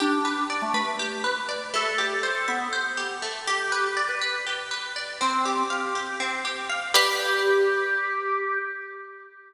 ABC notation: X:1
M:7/8
L:1/16
Q:1/4=121
K:G
V:1 name="Pizzicato Strings"
z14 | z14 | z14 | z14 |
G14 |]
V:2 name="Drawbar Organ"
D4 z A, A,2 z6 | A4 z A B,2 z6 | G4 z B B2 z6 | C4 G4 z6 |
G14 |]
V:3 name="Pizzicato Strings"
G2 B2 d2 B2 G2 B2 d2 | A,2 G2 c2 e2 c2 G2 A,2 | G2 B2 d2 B2 G2 B2 d2 | C2 G2 =f2 G2 C2 G2 f2 |
[GBd]14 |]